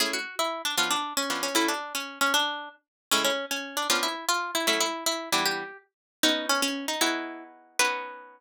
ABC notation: X:1
M:6/8
L:1/8
Q:3/8=154
K:Amix
V:1 name="Acoustic Guitar (steel)"
^G F2 E2 D | ^E D2 C2 C | E D2 C2 C | D3 z3 |
C C2 C2 D | ^E =E2 ^E2 =E | E E2 E2 E | G3 z3 |
[K:Bmix] D2 C C2 D | E4 z2 | B6 |]
V:2 name="Acoustic Guitar (steel)"
[A,CE^G]6 | [^E,B,CD]4 [E,B,CD]2 | [F,A,CE]6 | z6 |
[A,,C,^G,E]6 | [^E,B,CD]6 | [F,A,CE]5 [E,G,B,D]- | [E,G,B,D]6 |
[K:Bmix] [B,CDF]6 | [B,DEFG]6 | [B,CDF]6 |]